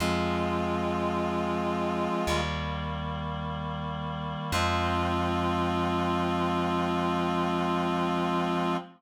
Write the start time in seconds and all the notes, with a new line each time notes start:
0.00 F2 F3 G#3 C4 F4
2.27 D#2 D#3 G3 A#3
4.52 F2 F3 G#3 C4 F4